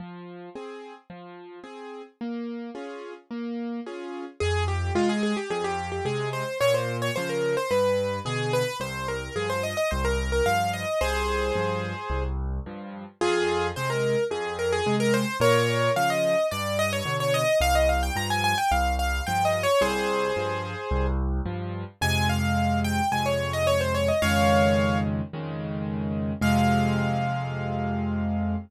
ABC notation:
X:1
M:4/4
L:1/16
Q:1/4=109
K:Fm
V:1 name="Acoustic Grand Piano"
z16 | z16 | A2 G2 F A A G A G2 G A2 c2 | d c2 d c B2 c =B4 A2 B2 |
c2 B2 A c e e c B2 B f2 e2 | [Ac]10 z6 | [FA]4 c B3 A2 B A2 B c2 | [Bd]4 f e3 =d2 e _d2 d e2 |
f e f g b a a g f2 f2 (3g2 e2 d2 | [Ac]10 z6 | a2 f4 g2 a d2 e d c d e | [df]6 z10 |
f16 |]
V:2 name="Acoustic Grand Piano"
F,4 [CA]4 F,4 [CA]4 | B,4 [DFA]4 B,4 [DFA]4 | F,,4 [C,A,]4 F,,4 [C,A,]4 | B,,4 [D,F,]4 G,,4 [=B,,=D,]4 |
C,,4 [G,,F,]4 C,,4 [G,,F,]4 | C,,4 [G,,F,]4 C,,4 [G,,F,]4 | F,,4 [C,A,]4 F,,4 [C,A,]4 | B,,4 [D,F,]4 G,,4 [=B,,=D,]4 |
C,,4 [G,,F,]4 C,,4 [G,,F,]4 | C,,4 [G,,F,]4 C,,4 [G,,F,]4 | [F,,C,A,]8 [F,,C,A,]8 | [F,,D,E,A,]8 [F,,D,E,A,]8 |
[F,,C,A,]16 |]